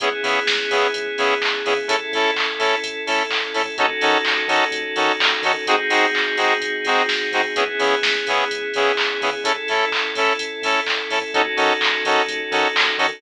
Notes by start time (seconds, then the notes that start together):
0.00 C#2 B3 C#4 E4 G#4, kick, closed hi-hat
0.23 C#3 B3 C#4 E4 G#4, open hi-hat
0.47 C#2, kick, snare
0.70 C#3 B3 C#4 E4 G#4, open hi-hat
0.94 C#2, kick, closed hi-hat
1.18 C#3 B3 C#4 E4 G#4, open hi-hat
1.42 C#2, kick, clap
1.65 C#3 B3 C#4 E4 G#4, open hi-hat
1.88 A1 C#4 E4 A4, kick, closed hi-hat
2.12 A2 C#4 E4 A4, open hi-hat
2.36 A1, kick, clap
2.59 A2 C#4 E4 A4, open hi-hat
2.83 A1, kick, closed hi-hat
3.07 A2 C#4 E4 A4, open hi-hat
3.30 A1, kick, clap
3.54 A2 C#4 E4 A4, open hi-hat
3.78 D#2 C#4 D#4 F#4 A4, kick, closed hi-hat
4.01 D#3 C#4 D#4 F#4 A4, open hi-hat
4.25 D#2, kick, clap
4.48 D#3 C#4 D#4 F#4 A4, open hi-hat
4.71 D#2, kick, closed hi-hat
4.96 D#3 C#4 D#4 F#4 A4, open hi-hat
5.20 D#2, kick, clap
5.42 D#3 C#4 D#4 F#4 A4, open hi-hat
5.67 G#1 C4 D#4 F#4 G#4, kick, closed hi-hat
5.90 G#2 C4 D#4 F#4 G#4, open hi-hat
6.14 G#1, kick, clap
6.37 G#2 C4 D#4 F#4 G#4, open hi-hat
6.61 G#1, kick, closed hi-hat
6.85 G#2 C4 D#4 F#4 G#4, open hi-hat
7.08 G#1, kick, snare
7.32 G#2 C4 D#4 F#4 G#4, open hi-hat
7.56 C#2 B3 C#4 E4 G#4, kick, closed hi-hat
7.79 C#3 B3 C#4 E4 G#4, open hi-hat
8.03 C#2, kick, snare
8.27 C#3 B3 C#4 E4 G#4, open hi-hat
8.50 C#2, kick, closed hi-hat
8.74 C#3 B3 C#4 E4 G#4, open hi-hat
8.97 C#2, kick, clap
9.21 C#3 B3 C#4 E4 G#4, open hi-hat
9.44 A1 C#4 E4 A4, kick, closed hi-hat
9.68 A2 C#4 E4 A4, open hi-hat
9.91 A1, kick, clap
10.15 A2 C#4 E4 A4, open hi-hat
10.38 A1, kick, closed hi-hat
10.62 A2 C#4 E4 A4, open hi-hat
10.86 A1, kick, clap
11.10 A2 C#4 E4 A4, open hi-hat
11.34 D#2 C#4 D#4 F#4 A4, kick, closed hi-hat
11.57 D#3 C#4 D#4 F#4 A4, open hi-hat
11.81 D#2, kick, clap
12.05 D#3 C#4 D#4 F#4 A4, open hi-hat
12.27 D#2, kick, closed hi-hat
12.51 D#3 C#4 D#4 F#4 A4, open hi-hat
12.75 D#2, kick, clap
12.98 D#3 C#4 D#4 F#4 A4, open hi-hat